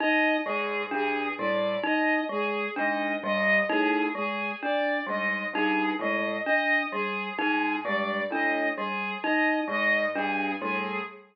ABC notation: X:1
M:6/4
L:1/8
Q:1/4=65
K:none
V:1 name="Acoustic Grand Piano" clef=bass
z ^G,, =G,, A,, z2 ^G,, =G,, A,, z2 ^G,, | G,, A,, z2 ^G,, =G,, A,, z2 ^G,, =G,, A,, |]
V:2 name="Glockenspiel"
^D ^G, =D =G, ^D ^G, =D =G, ^D ^G, =D =G, | ^D ^G, =D =G, ^D ^G, =D =G, ^D ^G, =D =G, |]
V:3 name="Violin"
^d ^G G =d ^d G d d G G =d ^d | ^G ^d d G G =d ^d G d d G G |]